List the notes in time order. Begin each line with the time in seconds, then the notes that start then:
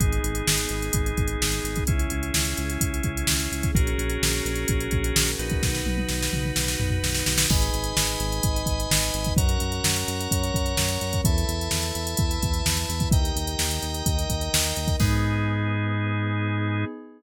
0.00 G#1 B3 D#4 G#4, kick, closed hi-hat
0.12 closed hi-hat
0.23 G#1, closed hi-hat
0.35 closed hi-hat
0.47 G#1, snare
0.58 closed hi-hat
0.69 G#1, closed hi-hat
0.82 closed hi-hat
0.93 G#1, kick, closed hi-hat
1.06 closed hi-hat
1.17 G#1, kick, closed hi-hat
1.28 closed hi-hat
1.41 G#1, snare
1.52 closed hi-hat
1.64 G#1, closed hi-hat
1.76 kick, closed hi-hat
1.87 C#2 C#4 E4 G#4, kick, closed hi-hat
1.99 closed hi-hat
2.10 C#2, closed hi-hat
2.23 closed hi-hat
2.34 C#2, snare
2.45 closed hi-hat
2.57 C#2, closed hi-hat
2.70 closed hi-hat
2.81 C#2, kick, closed hi-hat
2.94 closed hi-hat
3.03 C#2, kick, closed hi-hat
3.17 closed hi-hat
3.27 C#2, snare
3.40 closed hi-hat
3.52 C#2, closed hi-hat
3.63 kick, closed hi-hat
3.75 A#1 C#4 F#4 G#4 A#4, kick, closed hi-hat
3.87 closed hi-hat
3.98 A#1, closed hi-hat
4.10 closed hi-hat
4.22 A#1, snare
4.33 closed hi-hat
4.45 A#1, closed hi-hat
4.56 closed hi-hat
4.68 A#1, kick, closed hi-hat
4.80 closed hi-hat
4.91 A#1, kick, closed hi-hat
5.04 closed hi-hat
5.16 A#1, snare
5.28 closed hi-hat
5.39 A#1 D#4 F#4 B4, closed hi-hat
5.50 kick, closed hi-hat
5.62 B1 D#4 F#4 B4, kick, snare
5.75 snare
5.86 B1, high tom
5.97 high tom
6.09 B1, snare
6.23 snare
6.33 B1, mid tom
6.45 mid tom
6.56 B1, snare
6.68 snare
6.80 B1, floor tom
6.91 floor tom
7.03 B1, snare
7.15 snare
7.26 B1, snare
7.38 snare
7.50 G#1 D#4 G#4 B4 D#5 G#5 B5, kick, crash
7.62 closed hi-hat
7.73 G#1, closed hi-hat
7.84 closed hi-hat
7.97 G#1, snare
8.07 closed hi-hat
8.20 G#1, closed hi-hat
8.32 closed hi-hat
8.43 G#1 D#4 B4 D#5, kick, closed hi-hat
8.56 closed hi-hat
8.66 G#1, kick, closed hi-hat
8.80 closed hi-hat
8.91 G#1, snare
9.03 closed hi-hat
9.14 G#1, closed hi-hat
9.25 kick, closed hi-hat
9.37 F#2 C#4 F#4 A#4 C#5 F#5 A#5, kick, closed hi-hat
9.49 closed hi-hat
9.60 F#2, closed hi-hat
9.72 closed hi-hat
9.84 F#2, snare
9.96 closed hi-hat
10.08 F#2, closed hi-hat
10.21 closed hi-hat
10.31 F#2 C#4 A#4 C#5, kick, closed hi-hat
10.44 closed hi-hat
10.54 F#2, kick, closed hi-hat
10.66 closed hi-hat
10.77 F#2, snare
10.89 closed hi-hat
11.01 F#2, closed hi-hat
11.13 kick, closed hi-hat
11.25 E2 E4 A4 B4 E5 A5 B5, kick, closed hi-hat
11.38 closed hi-hat
11.48 E2, closed hi-hat
11.61 closed hi-hat
11.71 E2, snare
11.82 closed hi-hat
11.95 E2, closed hi-hat
12.07 closed hi-hat
12.17 E2 E4 B4 E5, kick, closed hi-hat
12.31 closed hi-hat
12.42 E2, kick, closed hi-hat
12.54 closed hi-hat
12.66 E2, snare
12.77 closed hi-hat
12.89 E2, closed hi-hat
13.00 kick, closed hi-hat
13.11 D#2 D#4 G4 A#4 D#5 G5 A#5, kick, closed hi-hat
13.25 closed hi-hat
13.36 D#2, closed hi-hat
13.47 closed hi-hat
13.59 D#2, snare
13.71 closed hi-hat
13.83 D#2, closed hi-hat
13.94 closed hi-hat
14.06 D#2 D#4 A#4 D#5, kick, closed hi-hat
14.19 closed hi-hat
14.30 D#2, kick, closed hi-hat
14.41 closed hi-hat
14.53 D#2, snare
14.64 closed hi-hat
14.76 D#2, closed hi-hat
14.88 kick, closed hi-hat
15.00 G#2 B3 D#4 G#4, kick, crash